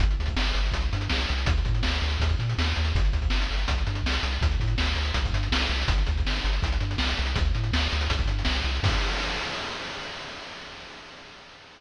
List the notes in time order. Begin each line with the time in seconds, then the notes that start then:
0.00 G1, kick, closed hi-hat
0.11 closed hi-hat
0.19 D2, closed hi-hat
0.26 kick, closed hi-hat
0.36 G1, snare
0.45 closed hi-hat
0.54 G1, closed hi-hat
0.65 closed hi-hat
0.72 C2, kick, closed hi-hat
0.81 closed hi-hat
0.93 G2, closed hi-hat
1.01 closed hi-hat
1.10 C2, snare
1.19 closed hi-hat
1.29 C2, closed hi-hat
1.38 closed hi-hat
1.46 D2, kick, closed hi-hat
1.57 closed hi-hat
1.65 A2, kick, closed hi-hat
1.75 closed hi-hat
1.83 D2, snare
1.93 closed hi-hat
2.02 D2, closed hi-hat
2.10 closed hi-hat
2.20 D#2, kick, closed hi-hat
2.29 kick, closed hi-hat
2.39 A#2, closed hi-hat
2.49 closed hi-hat
2.58 D#2, snare
2.69 closed hi-hat
2.76 D#2, closed hi-hat
2.85 closed hi-hat
2.95 G1, kick, closed hi-hat
3.05 closed hi-hat
3.13 D2, kick, closed hi-hat
3.22 kick, closed hi-hat
3.30 G1, snare
3.41 closed hi-hat
3.51 G1, closed hi-hat
3.58 closed hi-hat
3.68 C2, kick, closed hi-hat
3.78 closed hi-hat
3.87 G2, closed hi-hat
3.95 closed hi-hat
4.04 C2, snare
4.13 closed hi-hat
4.23 C2, closed hi-hat
4.32 closed hi-hat
4.41 D2, kick, closed hi-hat
4.51 closed hi-hat
4.60 A2, kick, closed hi-hat
4.67 closed hi-hat
4.78 D2, snare
4.86 closed hi-hat
4.95 D2, closed hi-hat
5.05 closed hi-hat
5.14 C2, kick, closed hi-hat
5.25 kick, closed hi-hat
5.33 G2, closed hi-hat
5.43 closed hi-hat
5.52 C2, snare
5.62 closed hi-hat
5.69 C2, closed hi-hat
5.82 closed hi-hat
5.88 G1, kick, closed hi-hat
5.98 closed hi-hat
6.07 D2, kick, closed hi-hat
6.17 kick, closed hi-hat
6.25 G1, snare
6.36 closed hi-hat
6.44 G1, closed hi-hat
6.53 closed hi-hat
6.62 C2, kick, closed hi-hat
6.72 closed hi-hat
6.80 G2, closed hi-hat
6.91 closed hi-hat
6.98 C2, snare
7.09 closed hi-hat
7.17 C2, closed hi-hat
7.26 closed hi-hat
7.36 D2, kick, closed hi-hat
7.45 closed hi-hat
7.55 A2, closed hi-hat
7.64 closed hi-hat
7.73 D2, snare
7.82 closed hi-hat
7.92 D2, closed hi-hat
8.01 closed hi-hat
8.10 C2, kick, closed hi-hat
8.19 kick, closed hi-hat
8.28 G2, closed hi-hat
8.39 closed hi-hat
8.45 C2, snare
8.55 closed hi-hat
8.64 C2, closed hi-hat
8.75 closed hi-hat
8.83 G2, kick, crash